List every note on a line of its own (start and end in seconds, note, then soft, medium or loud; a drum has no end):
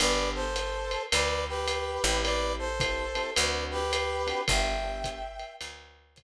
0.00 0.96 G1 medium
0.00 0.44 B3 medium
0.00 0.44 D4 medium
0.00 0.44 G4 medium
0.00 0.44 A4 medium
0.00 0.29 B4 medium
0.00 0.29 D5 medium
0.00 ride loud
0.35 1.03 A4 medium
0.35 1.03 C5 medium
0.56 hi-hat pedal medium
0.56 ride medium
0.91 ride medium
1.12 1.98 D2 medium
1.12 1.44 B4 medium
1.12 1.44 D5 medium
1.12 ride loud
1.48 2.23 G4 medium
1.48 2.23 B4 medium
1.68 hi-hat pedal medium
1.68 ride medium
2.03 3.20 A1 medium
2.03 2.68 C4 medium
2.03 2.68 E4 medium
2.03 2.68 G4 medium
2.03 2.68 A4 medium
2.03 ride medium
2.23 2.53 B4 medium
2.23 2.53 D5 medium
2.23 ride medium
2.59 3.30 A4 medium
2.59 3.30 C5 medium
2.80 3.05 C4 medium
2.80 3.05 E4 medium
2.80 3.05 G4 medium
2.80 3.05 A4 medium
2.80 kick medium
2.80 hi-hat pedal medium
2.80 ride medium
3.15 3.30 C4 medium
3.15 3.30 E4 medium
3.15 3.30 G4 medium
3.15 3.30 A4 medium
3.15 ride medium
3.35 4.32 D2 medium
3.35 3.80 C4 medium
3.35 3.80 D4 medium
3.35 3.80 F#4 medium
3.35 3.80 A4 medium
3.35 3.64 B4 medium
3.35 3.64 D5 medium
3.35 ride loud
3.71 4.41 G4 medium
3.71 4.41 B4 medium
3.93 hi-hat pedal medium
3.93 ride medium
4.27 4.41 C4 medium
4.27 4.41 D4 medium
4.27 4.41 F#4 medium
4.27 4.41 A4 medium
4.27 ride medium
4.48 5.44 G1 medium
4.48 4.73 B3 medium
4.48 4.73 D4 medium
4.48 4.73 G4 medium
4.48 4.73 A4 loud
4.48 5.53 E5 medium
4.48 5.53 G5 medium
4.48 kick medium
4.48 ride loud
4.84 5.19 B3 medium
4.84 5.19 D4 medium
4.84 5.19 G4 medium
4.84 5.19 A4 medium
5.04 kick medium
5.04 hi-hat pedal medium
5.04 ride medium
5.39 ride medium
5.61 6.23 D2 medium
5.61 ride loud
6.16 kick medium
6.16 hi-hat pedal medium
6.16 ride medium